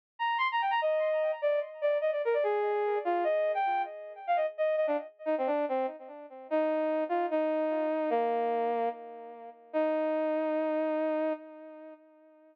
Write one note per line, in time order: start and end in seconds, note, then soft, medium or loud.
0.19 0.37 A#5 medium
0.38 0.48 C6 loud
0.52 0.61 A#5 medium
0.62 0.71 G5 medium
0.71 0.80 A#5 loud
0.82 1.31 D#5 loud
1.42 1.60 D5 loud
1.82 1.98 D5 loud
2.01 2.11 D#5 loud
2.12 2.22 D5 medium
2.25 2.34 A#4 loud
2.34 2.43 D5 loud
2.43 2.98 G#4 loud
3.05 3.24 F4 medium
3.24 3.52 D#5 loud
3.54 3.82 G5 medium
4.27 4.37 F5 loud
4.36 4.46 D#5 medium
4.58 4.76 D#5 medium
4.77 4.86 D#5 medium
4.87 4.97 D4 loud
5.26 5.35 D#4 medium
5.38 5.48 C4 medium
5.47 5.65 D4 medium
5.69 5.86 C4 medium
6.50 7.04 D#4 loud
7.09 7.26 F4 medium
7.31 8.10 D#4 loud
8.10 8.89 A#3 loud
9.73 11.33 D#4 loud